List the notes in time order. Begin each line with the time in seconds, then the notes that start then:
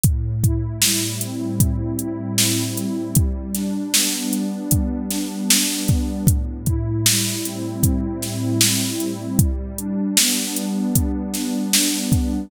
0.04 A2, kick, closed hi-hat
0.43 E4, kick, closed hi-hat
0.82 G3, snare
1.21 C4, closed hi-hat
1.60 A2, kick, closed hi-hat
1.99 E4, closed hi-hat
2.38 C4, snare
2.77 G3, closed hi-hat
3.15 G3, kick, closed hi-hat
3.55 D4, snare, closed hi-hat
3.94 B3, snare
4.33 D4, closed hi-hat
4.71 G3, kick, closed hi-hat
5.11 D4, snare, closed hi-hat
5.50 D4, snare
5.88 B3, kick, closed hi-hat
6.27 A2, kick, closed hi-hat
6.66 E4, kick, closed hi-hat
7.06 G3, snare
7.44 C4, closed hi-hat
7.83 A2, kick, closed hi-hat
8.22 E4, snare, closed hi-hat
8.61 C4, snare
9.00 G3, closed hi-hat
9.39 G3, kick, closed hi-hat
9.78 D4, closed hi-hat
10.17 B3, snare
10.56 D4, closed hi-hat
10.95 G3, kick, closed hi-hat
11.34 D4, snare, closed hi-hat
11.73 D4, snare
12.12 B3, kick, closed hi-hat